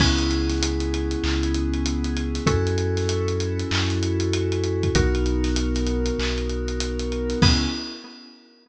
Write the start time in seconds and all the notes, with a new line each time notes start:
0.00 C#2 B3 C#4 E4 G#4, kick, crash
0.19 closed hi-hat
0.30 snare, closed hi-hat
0.49 snare, closed hi-hat
0.63 closed hi-hat
0.80 closed hi-hat
0.94 closed hi-hat
1.11 closed hi-hat
1.24 C#2, clap
1.43 closed hi-hat
1.54 closed hi-hat
1.74 closed hi-hat
1.86 closed hi-hat
2.04 closed hi-hat
2.17 closed hi-hat
2.35 snare, closed hi-hat
2.46 F#2 C#4 E4 F#4 A4, kick, closed hi-hat
2.67 closed hi-hat
2.78 closed hi-hat
2.97 snare, closed hi-hat
3.09 closed hi-hat
3.28 closed hi-hat
3.40 closed hi-hat
3.59 closed hi-hat
3.71 F#2, clap
3.89 snare, closed hi-hat
4.03 closed hi-hat
4.20 closed hi-hat
4.33 closed hi-hat
4.52 closed hi-hat
4.64 closed hi-hat
4.83 kick, closed hi-hat
4.95 B1 B3 D#4 F#4 A#4, kick, closed hi-hat
5.15 closed hi-hat
5.26 closed hi-hat
5.44 snare, closed hi-hat
5.56 closed hi-hat
5.75 snare, closed hi-hat
5.87 closed hi-hat
6.06 closed hi-hat
6.19 B1, clap
6.38 closed hi-hat
6.49 closed hi-hat
6.68 closed hi-hat
6.80 closed hi-hat
6.99 closed hi-hat
7.12 closed hi-hat
7.30 snare, closed hi-hat
7.42 C#2 B3 C#4 E4 G#4, kick, crash